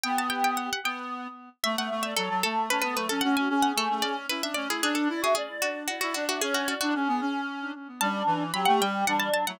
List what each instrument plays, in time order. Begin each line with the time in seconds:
0.03 clarinet B3, choir aahs G4, harpsichord G5
0.18 harpsichord A5
0.30 harpsichord G5
0.44 harpsichord G5
0.57 harpsichord F#5
0.73 harpsichord F#5
0.84 clarinet B3, harpsichord G5
1.63 clarinet A3, choir aahs E5, harpsichord E5
1.77 clarinet A3, choir aahs E5, harpsichord F#5
1.91 clarinet A3
2.03 choir aahs D5, harpsichord E5
2.16 clarinet F#3, harpsichord A4, choir aahs A4
2.30 clarinet F#3
2.43 clarinet A3, harpsichord A4
2.70 clarinet C#4, choir aahs A4, harpsichord B4
2.82 clarinet B3, harpsichord B4
2.95 clarinet A3, harpsichord B4
3.09 clarinet C#4, harpsichord A4, choir aahs A4
3.21 clarinet C#4, choir aahs F#4, harpsichord F#5
3.36 clarinet C#4, choir aahs F#4, harpsichord G#5
3.49 clarinet C#4, choir aahs G#4
3.62 harpsichord F#5
3.76 clarinet A3, harpsichord A4
3.90 clarinet A3
4.02 clarinet C#4, harpsichord D5
4.29 clarinet E4, harpsichord B4
4.42 clarinet D4, harpsichord E5
4.54 clarinet C#4, harpsichord D5
4.68 clarinet E4, harpsichord G#4
4.82 clarinet D4, harpsichord G#4, choir aahs D5
4.95 harpsichord A4, choir aahs D5
5.09 clarinet E4
5.21 clarinet F#4, harpsichord G#4, choir aahs E5
5.35 harpsichord G#4, choir aahs D5
5.62 harpsichord F#4
5.88 harpsichord F#4, choir aahs D5
6.01 clarinet E4, harpsichord F#4
6.14 clarinet D4, harpsichord F#4
6.28 harpsichord F#4, choir aahs E5
6.41 clarinet C#4, harpsichord G#4, choir aahs C#5
6.54 harpsichord F#4, choir aahs C#5
6.68 harpsichord F#4, choir aahs D5
6.81 clarinet D4, harpsichord F#4
6.94 clarinet C#4, choir aahs G#4
7.08 clarinet B3
7.21 clarinet C#4
8.01 clarinet G3, choir aahs D4, harpsichord A5
8.26 clarinet E3
8.53 clarinet F#3, choir aahs G4, harpsichord B5
8.65 clarinet A3, harpsichord F#5
8.80 clarinet G3, harpsichord G5
9.07 clarinet G3, choir aahs D4, harpsichord F#5
9.19 harpsichord A5
9.34 harpsichord A5
9.47 clarinet F#3, choir aahs E4, harpsichord F#5